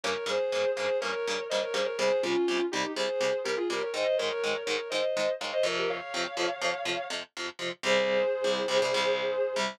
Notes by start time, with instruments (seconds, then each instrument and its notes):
0.04 overdriven guitar G2 C#3 A#3, distortion guitar A#4 C#5
0.26 overdriven guitar G2 C#3 A#3, distortion guitar G#4 C5
0.52 overdriven guitar G2 C#3 A#3
0.75 overdriven guitar G2 C#3 A#3, distortion guitar G#4 C5
1.00 overdriven guitar G2 C#3 A#3, distortion guitar A#4 C#5
1.27 overdriven guitar G2 C#3 A#3
1.49 overdriven guitar G2 C#3 A#3, distortion guitar C5 D#5
1.62 distortion guitar A#4 C#5
1.73 overdriven guitar G2 C#3 A#3, distortion guitar G#4 C5
1.85 distortion guitar A#4 C#5
1.98 overdriven guitar C2 C3 G3, distortion guitar G#4 C5
2.22 overdriven guitar C2 C3 G3, distortion guitar C#4 F4
2.48 overdriven guitar C2 C3 G3
2.71 overdriven guitar C2 C3 G3, distortion guitar D#4 G4
2.96 overdriven guitar C2 C3 G3, distortion guitar G#4 C5
3.21 overdriven guitar C2 C3 G3
3.44 overdriven guitar C2 C3 G3, distortion guitar G4 A#4
3.57 distortion guitar F4 G#4
3.70 overdriven guitar C2 C3 G3, distortion guitar G4 A#4
3.82 distortion guitar A#4 C#5
3.94 overdriven guitar G#2 D#3 G#3, distortion guitar C5 D#5
4.18 overdriven guitar G#2 D#3 G#3, distortion guitar A#4 C#5
4.43 overdriven guitar G#2 D#3 G#3
4.65 overdriven guitar G#2 D#3 G#3, distortion guitar A#4 C#5
4.90 overdriven guitar G#2 D#3 G#3, distortion guitar C5 D#5
5.17 overdriven guitar G#2 D#3 G#3
5.40 overdriven guitar G#2 D#3 G#3, distortion guitar C#5 F5
5.53 distortion guitar C5 D#5
5.63 overdriven guitar F2 C3 F3, distortion guitar A#4 C#5
5.78 distortion guitar G4 A#4
5.89 distortion guitar C#5 F5
6.14 overdriven guitar F2 C3 F3
6.37 overdriven guitar F2 C3 F3
6.61 overdriven guitar F2 C3 F3
6.85 overdriven guitar F2 C3 F3
7.10 overdriven guitar F2 C3 F3
7.37 overdriven guitar F2 C3 F3
7.59 overdriven guitar F2 C3 F3
7.83 overdriven guitar C2 C3 G3, distortion guitar G#4 C5
8.44 overdriven guitar C2 C3 G3
8.68 overdriven guitar C2 C3 G3
8.82 overdriven guitar C2 C3 G3
8.94 overdriven guitar C2 C3 G3
9.56 overdriven guitar C2 C3 G3